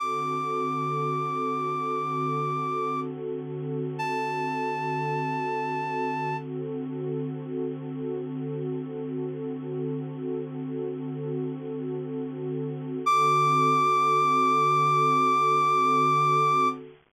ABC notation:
X:1
M:12/8
L:1/8
Q:3/8=75
K:D
V:1 name="Clarinet"
d'12 | z3 a9 | z12 | "^rit." z12 |
d'12 |]
V:2 name="Pad 2 (warm)"
[D,=CFA]12- | [D,=CFA]12 | [D,=CFA]12- | "^rit." [D,=CFA]12 |
[D,=CFA]12 |]